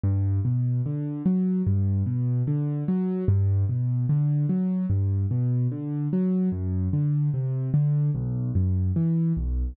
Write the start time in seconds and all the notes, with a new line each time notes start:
0.04 G2
0.45 B2
0.86 D3
1.26 F#3
1.67 G2
2.06 B2
2.47 D3
2.88 F#3
3.28 G2
3.69 B2
4.09 D3
4.49 F#3
4.90 G2
5.31 B2
5.72 D3
6.13 F#3
6.52 F#2
6.93 D3
7.34 C3
7.74 D3
8.15 B1
8.55 F#2
8.96 E3
9.37 B1